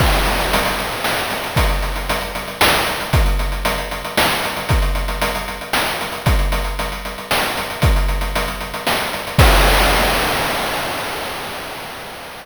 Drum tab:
CC |x-----------|------------|------------|------------|
HH |-xxxxxxx--xx|xxxxxxxx-xxx|xxxxxxxx-xxx|xxxxxxxx-xxx|
SD |--------oo--|--------o---|--------o---|--------o---|
BD |o-----------|o-----------|o-----------|o-----------|

CC |------------|------------|x-----------|
HH |xxxxxxxx-xxx|xxxxxxxx-xxx|------------|
SD |--------o---|--------o---|------------|
BD |o-----------|o-----------|o-----------|